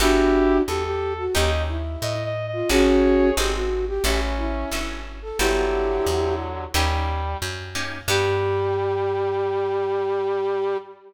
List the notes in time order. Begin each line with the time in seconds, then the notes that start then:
0.00 G1 B3 D4 E4 F#4 G4 A4
0.67 E2 G4 A4
0.85 G4
1.18 F#4
1.35 D#2 A#3 C#4 D#4 G4 D#5
1.69 E4
2.02 A2 D#5
2.25 D#5
2.47 D#5
2.53 F4
2.69 G#1 C#4 D#4 F#4 G#4 C#5
3.37 G#1 C4 F#4 G4 G#4 A4
3.54 F#4
3.88 G4
4.04 A1 C#4 E4 F#4 G4 A4
4.38 E4
4.71 G1 C#4 E4 F#4 A4
5.22 A4
5.39 G1 D3 F#3 B3 E4 F#4 G4 A4
6.06 E2
6.74 D#2 G3 A#3 C#4 D#4 G4
7.42 F#2
7.75 A#3 C#4 D#4 G4
8.08 G2 G3 B3 F#4 G4 A4